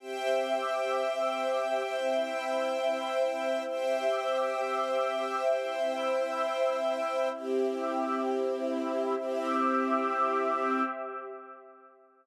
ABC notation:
X:1
M:4/4
L:1/8
Q:1/4=131
K:Cmix
V:1 name="String Ensemble 1"
[ceg]8- | [ceg]8 | [ceg]8- | [ceg]8 |
[CEG]8 | [CEG]8 |]
V:2 name="Pad 2 (warm)"
[CGe]8 | [CEe]8 | [CGe]8 | [CEe]8 |
[CGe]4 [CEe]4 | [CGe]8 |]